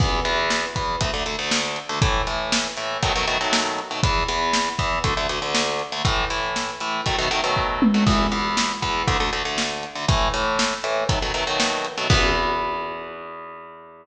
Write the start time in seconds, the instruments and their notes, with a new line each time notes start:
0.00 overdriven guitar E2 E3 B3, kick, crash
0.25 overdriven guitar E2 E3 B3, closed hi-hat
0.50 snare
0.76 overdriven guitar E2 E3 B3, kick, closed hi-hat
1.01 overdriven guitar D2 D3 A3, kick, closed hi-hat
1.14 overdriven guitar D2 D3 A3
1.26 overdriven guitar D2 D3 A3, closed hi-hat
1.39 overdriven guitar D2 D3 A3
1.51 snare
1.76 closed hi-hat
1.89 overdriven guitar D2 D3 A3
2.02 overdriven guitar A2 E3 A3, kick, closed hi-hat
2.27 overdriven guitar A2 E3 A3, closed hi-hat
2.52 snare
2.77 overdriven guitar A2 E3 A3, closed hi-hat
3.03 overdriven guitar B2 D#3 F#3 A3, kick, closed hi-hat
3.16 overdriven guitar B2 D#3 F#3 A3
3.27 overdriven guitar B2 D#3 F#3 A3, closed hi-hat
3.41 overdriven guitar B2 D#3 F#3 A3
3.53 snare
3.79 closed hi-hat
3.91 overdriven guitar B2 D#3 F#3 A3
4.03 overdriven guitar E2 E3 B3, kick, closed hi-hat
4.28 overdriven guitar E2 E3 B3, closed hi-hat
4.53 snare
4.79 overdriven guitar E2 E3 B3, kick, closed hi-hat
5.04 overdriven guitar D2 D3 A3, kick, closed hi-hat
5.17 overdriven guitar D2 D3 A3
5.29 overdriven guitar D2 D3 A3, closed hi-hat
5.42 overdriven guitar D2 D3 A3
5.55 snare
5.79 closed hi-hat
5.92 overdriven guitar D2 D3 A3
6.05 overdriven guitar A2 E3 A3, kick, closed hi-hat
6.30 overdriven guitar A2 E3 A3, closed hi-hat
6.56 snare
6.80 overdriven guitar A2 E3 A3, closed hi-hat
7.06 overdriven guitar B2 D#3 F#3 A3, kick, closed hi-hat
7.18 overdriven guitar B2 D#3 F#3 A3
7.31 overdriven guitar B2 D#3 F#3 A3, closed hi-hat
7.44 overdriven guitar B2 D#3 F#3 A3
7.57 kick
7.82 high tom
7.94 overdriven guitar B2 D#3 F#3 A3
8.07 overdriven guitar E2 E3 B3, kick, crash
8.32 overdriven guitar E2 E3 B3, closed hi-hat
8.57 snare
8.82 overdriven guitar E2 E3 B3, kick, closed hi-hat
9.07 overdriven guitar D2 D3 A3, kick, closed hi-hat
9.20 overdriven guitar D2 D3 A3
9.33 overdriven guitar D2 D3 A3, closed hi-hat
9.45 overdriven guitar D2 D3 A3
9.58 snare
9.83 closed hi-hat
9.95 overdriven guitar D2 D3 A3
10.08 overdriven guitar A2 E3 A3, kick, closed hi-hat
10.34 overdriven guitar A2 E3 A3, closed hi-hat
10.59 snare
10.84 overdriven guitar A2 E3 A3, closed hi-hat
11.09 overdriven guitar B2 D#3 F#3 A3, kick, closed hi-hat
11.22 overdriven guitar B2 D#3 F#3 A3
11.34 overdriven guitar B2 D#3 F#3 A3, closed hi-hat
11.47 overdriven guitar B2 D#3 F#3 A3
11.60 snare
11.85 closed hi-hat
11.98 overdriven guitar B2 D#3 F#3 A3
12.10 overdriven guitar E2 E3 B3, kick, crash